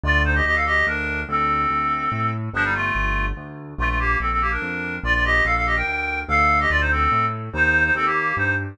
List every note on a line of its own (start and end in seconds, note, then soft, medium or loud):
0.04 0.41 D2 loud
0.04 0.22 F4 medium
0.04 0.22 D5 loud
0.24 0.34 D#4 medium
0.24 0.34 C5 medium
0.35 0.45 G4 medium
0.35 0.45 D#5 medium
0.45 0.83 D2 medium
0.45 0.55 G4 medium
0.45 0.55 D#5 loud
0.55 0.65 A4 medium
0.55 0.65 F5 medium
0.66 0.86 G4 medium
0.66 0.86 D#5 loud
0.87 1.24 D2 medium
0.87 1.20 D4 medium
0.87 1.20 A#4 loud
1.29 1.66 D2 loud
1.29 2.31 C4 medium
1.29 2.31 A4 medium
1.70 2.08 D2 medium
2.12 2.49 A2 medium
2.53 2.91 G1 loud
2.53 2.64 F3 loud
2.53 2.64 D4 loud
2.64 2.74 G3 medium
2.64 2.74 D#4 medium
2.75 3.25 A3 medium
2.75 3.25 F4 medium
2.95 3.33 G1 loud
3.37 3.74 D2 medium
3.78 4.16 A#1 loud
3.78 3.88 A3 medium
3.78 3.88 F4 loud
3.89 3.99 A3 medium
3.89 3.99 F4 medium
3.99 4.18 A#3 medium
3.99 4.18 G4 loud
4.20 4.58 A#1 medium
4.20 4.30 C4 medium
4.20 4.30 A4 medium
4.31 4.41 C4 medium
4.31 4.41 A4 medium
4.41 4.51 A#3 medium
4.41 4.51 G4 medium
4.51 4.96 D4 medium
4.51 4.96 A#4 medium
4.62 4.99 F2 medium
5.03 5.41 A#1 loud
5.03 5.14 F4 medium
5.03 5.14 D5 loud
5.14 5.24 F4 medium
5.14 5.24 D5 medium
5.24 5.44 G4 loud
5.24 5.44 D#5 loud
5.45 5.83 A#1 medium
5.45 5.55 A4 medium
5.45 5.55 F5 loud
5.56 5.66 A4 medium
5.56 5.66 F5 loud
5.66 5.76 G4 medium
5.66 5.76 D#5 medium
5.76 6.20 A#4 medium
5.76 6.20 G5 medium
5.87 6.24 D2 medium
6.28 6.66 D2 loud
6.28 6.59 A4 loud
6.28 6.59 F5 loud
6.60 6.70 G4 medium
6.60 6.70 D#5 loud
6.70 7.08 D2 medium
6.70 6.80 F4 medium
6.70 6.80 D5 loud
6.81 6.91 D#4 medium
6.81 6.91 C5 medium
6.91 7.25 C4 medium
6.91 7.25 A4 medium
7.12 7.49 A2 medium
7.53 7.91 D#2 loud
7.53 7.84 D#4 medium
7.53 7.84 C5 loud
7.84 7.94 D#4 medium
7.84 7.94 C5 medium
7.95 8.33 D#2 loud
7.95 8.05 C4 medium
7.95 8.05 A4 loud
8.05 8.35 A#3 medium
8.05 8.35 G4 medium
8.37 8.74 G2 loud
8.37 8.54 D#4 medium
8.37 8.54 C5 medium